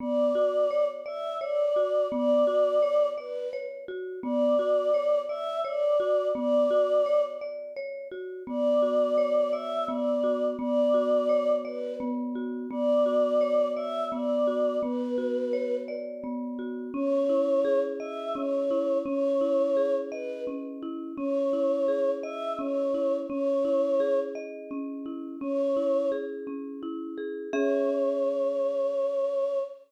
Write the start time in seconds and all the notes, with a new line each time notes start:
0.00 B3 D5
0.35 F#4
0.71 C#5
1.06 D5 E5
1.40 C#5 D5
1.76 F#4
2.12 B3 D5
2.47 F#4
2.82 C#5
3.17 B4 D5
3.53 C#5
3.88 F#4
4.23 B3 D5
4.59 F#4
4.94 C#5
5.29 D5 E5
5.65 C#5 D5
6.00 F#4
6.35 B3 D5
6.71 F#4
7.06 C#5
7.41 D5
7.76 C#5
8.11 F#4
8.47 B3 D5
8.82 F#4
9.18 C#5
9.52 D5 E5
9.88 B3 D5
10.24 F#4
10.59 B3 D5
10.94 F#4
11.29 C#5
11.65 B4 D5
12.00 B3
12.35 F#4
12.71 B3 D5
13.06 F#4
13.41 C#5
13.76 D5 E5
14.12 B3 D5
14.47 F#4
14.82 B3 B4
15.18 F#4
15.53 C#5
15.88 D5
16.24 B3
16.59 F#4
16.94 C#4 C#5
17.29 E4
17.65 G#4
18.00 D#5 E5
18.35 C#4 C#5
18.71 E4
19.05 C#4 C#5
19.41 E4
19.77 G#4
20.11 B4 D#5
20.47 C#4
20.82 E4
21.17 C#4 C#5
21.53 E4
21.88 G#4
22.23 D#5 E5
22.59 C#4 C#5
22.94 E4
23.29 C#4 C#5
23.65 E4
24.00 G#4
24.35 D#5
24.71 C#4
25.06 E4
25.41 C#4 C#5
25.76 E4
26.12 G#4
26.47 C#4
26.83 E4
27.18 G#4
27.53 C#4 G#4 C#5 E5